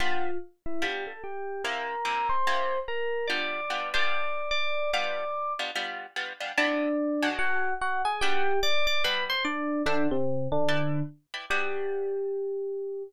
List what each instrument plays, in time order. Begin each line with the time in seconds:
0.00 acoustic guitar (steel) G3 B3 D4 F4, electric piano 1 F4 F5
0.66 electric piano 1 E4 E5
0.82 acoustic guitar (steel) G3 B3 D4 F4, electric piano 1 G4 G5
1.07 electric piano 1 A4 A5
1.24 electric piano 1 G4 G5
1.64 acoustic guitar (steel) C3 A#3 E4 G4, electric piano 1 A#4 A#5
2.05 acoustic guitar (steel) C3 A#3 E4 G4
2.29 electric piano 1 C5 C6
2.47 acoustic guitar (steel) C3 A#3 E4 G4
2.88 electric piano 1 A#4 A#5
3.27 acoustic guitar (steel) G3 B3 D4 F4, electric piano 1 D5 D6
3.70 acoustic guitar (steel) G3 B3 D4 F4
3.94 acoustic guitar (steel) G3 B3 D4 F4, electric piano 1 D5 D6
4.51 electric piano 1 D5 D6
4.93 acoustic guitar (steel) G3 B3 D4 F4, electric piano 1 D5 D6
5.59 acoustic guitar (steel) G3 B3 D4 F4
5.75 acoustic guitar (steel) G3 B3 D4 F4
6.16 acoustic guitar (steel) G3 B3 D4 F4
6.40 acoustic guitar (steel) G3 B3 D4 F4
6.57 acoustic guitar (steel) C3 B3 D4 E4, electric piano 1 D4 D5
7.22 acoustic guitar (steel) B2 G#3 D4 F#4
7.39 electric piano 1 F#4 F#5
7.81 electric piano 1 F#4 F#5
8.05 electric piano 1 G#4 G#5
8.21 acoustic guitar (steel) G3 B3 D4 F#4, electric piano 1 G4 G5
8.63 electric piano 1 D5 D6
8.87 electric piano 1 D5 D6
9.04 acoustic guitar (steel) G3 B3 D4 F#4, electric piano 1 B4 B5
9.30 electric piano 1 C5 C6
9.45 electric piano 1 D4 D5
9.86 electric piano 1 D3 D4, acoustic guitar (steel) D4 C5 E5 F#5
10.11 electric piano 1 C3 C4
10.52 electric piano 1 D3 D4
10.68 acoustic guitar (steel) E4 B4 D5 G5
11.34 acoustic guitar (steel) E4 B4 D5 G5
11.50 acoustic guitar (steel) G3 B3 D4 F#4, electric piano 1 G4